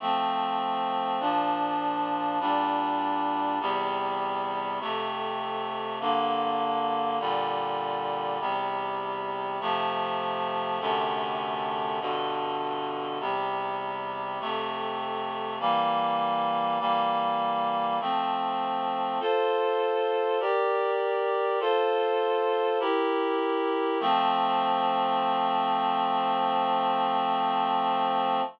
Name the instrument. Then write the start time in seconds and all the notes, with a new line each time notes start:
clarinet
0.00 F3 A3 C4
1.20 A#2 F3 D4
2.40 A#2 G3 D4
3.60 E2 C3 G3
4.80 F2 C3 A3
6.00 G2 D3 A#3
7.20 A#2 D3 G3
8.40 E2 C3 G3
9.60 C3 F3 A3
10.80 F#2 C3 D3 A3
12.00 G2 B2 D3
13.20 E2 C3 G3
14.40 F2 C3 A3
15.60 E3 G3 A#3
16.80 E3 G3 A#3
18.00 F3 A3 C4
19.20 F4 A4 C5
20.40 G4 A#4 D5
21.60 F4 A4 C5
22.80 E4 G4 A#4
24.00 F3 A3 C4